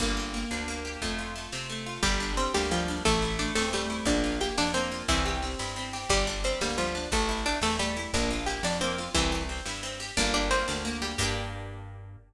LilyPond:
<<
  \new Staff \with { instrumentName = "Pizzicato Strings" } { \time 6/8 \key g \dorian \tempo 4. = 118 r2. | r2. | <g g'>4 <c' c''>8 <g g'>8 <f f'>4 | <a a'>4 <d' d''>8 <a a'>8 <g g'>4 |
<d' d''>4 <g' g''>8 <d' d''>8 <c' c''>4 | <e e'>4 r2 | <g g'>4 <c' c''>8 <g g'>8 <f f'>4 | <a a'>4 <d' d''>8 <a a'>8 <g g'>4 |
<d' d''>4 <g' g''>8 <d' d''>8 <c' c''>4 | <e e'>4 r2 | <d' d''>8 <d' d''>8 <c' c''>4 r8 <g g'>8 | g'2. | }
  \new Staff \with { instrumentName = "Orchestral Harp" } { \time 6/8 \key g \dorian bes8 g'8 bes8 d'8 bes8 g'8 | a8 f'8 a8 c'8 a8 f'8 | g8 d'8 g8 bes8 g8 d'8 | a8 e'8 a8 c'8 a8 e'8 |
bes8 f'8 bes8 d'8 bes8 f'8 | c'8 g'8 c'8 e'8 c'8 g'8 | g8 d'8 g8 bes8 g8 d'8 | a8 e'8 a8 c'8 a8 e'8 |
bes8 f'8 bes8 d'8 bes8 f'8 | c'8 g'8 c'8 e'8 c'8 g'8 | bes8 g'8 bes8 d'8 bes8 g'8 | <bes d' g'>2. | }
  \new Staff \with { instrumentName = "Electric Bass (finger)" } { \clef bass \time 6/8 \key g \dorian g,,4. d,4. | f,4. c4. | g,,4. d,4. | a,,4. e,4. |
bes,,4. f,4. | c,4. g,4. | g,,4. d,4. | a,,4. e,4. |
bes,,4. f,4. | c,4. g,4. | g,,4. d,4. | g,2. | }
  \new DrumStaff \with { instrumentName = "Drums" } \drummode { \time 6/8 <bd sn>16 sn16 sn16 sn16 sn16 sn16 sn16 sn16 sn16 sn16 sn16 sn16 | <bd sn>16 sn16 sn16 sn16 sn16 sn16 sn16 sn16 sn16 sn16 sn16 sn16 | <bd sn>16 sn16 sn16 sn16 sn16 sn16 sn16 sn16 sn16 sn16 sn16 sn16 | <bd sn>16 sn16 sn16 sn16 sn16 sn16 sn16 sn16 sn16 sn16 sn16 sn16 |
<bd sn>16 sn16 sn16 sn16 sn16 sn16 sn16 sn16 sn16 sn16 sn16 sn16 | <bd sn>16 sn16 sn16 sn16 sn16 sn16 sn16 sn16 sn16 sn16 sn16 sn16 | <bd sn>16 sn16 sn16 sn16 sn16 sn16 sn16 sn16 sn16 sn16 sn16 sn16 | <bd sn>16 sn16 sn16 sn16 sn16 sn16 sn16 sn16 sn16 sn16 sn16 sn16 |
<bd sn>16 sn16 sn16 sn16 sn16 sn16 sn16 sn16 sn16 sn16 sn16 sn16 | <bd sn>16 sn16 sn16 sn16 sn16 sn16 sn16 sn16 sn16 sn16 sn16 sn16 | <bd sn>16 sn16 sn16 sn16 sn16 sn16 sn16 sn16 sn16 sn16 sn16 sn16 | <cymc bd>4. r4. | }
>>